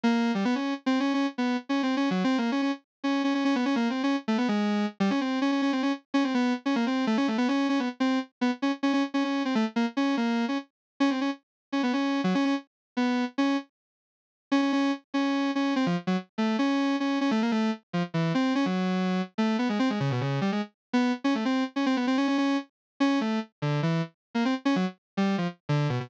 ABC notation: X:1
M:3/4
L:1/16
Q:1/4=145
K:none
V:1 name="Lead 1 (square)"
_B,3 G, =B, _D2 z (3C2 D2 D2 | z B,2 z (3_D2 C2 D2 (3_G,2 C2 _B,2 | _D D z3 D2 D D D B, D | (3_B,2 C2 _D2 z A, =B, _A,4 z |
G, _D C2 D D D C D z2 D | C B,2 z _D _B, C2 A, D A, =B, | _D2 D B, z C2 z2 B, z D | z _D D z D D2 C A, z _B, z |
_D2 _B,3 D z4 D C | _D z4 D B, D3 _G, D | _D z4 B,3 z D2 z | z8 _D D D2 |
z2 _D4 D2 C F, z _G, | z2 A,2 _D4 D2 D A, | _B, A,2 z2 F, z E,2 C2 _D | _G,6 z A,2 B, _A, C |
_A, _D, B,, D,2 G, A, z3 B,2 | z _D A, C2 z D C B, C D D | _D2 z4 D2 A,2 z2 | D,2 E,2 z3 _B, C z _D _G, |
z3 G,2 F, z2 D,2 B,, B,, |]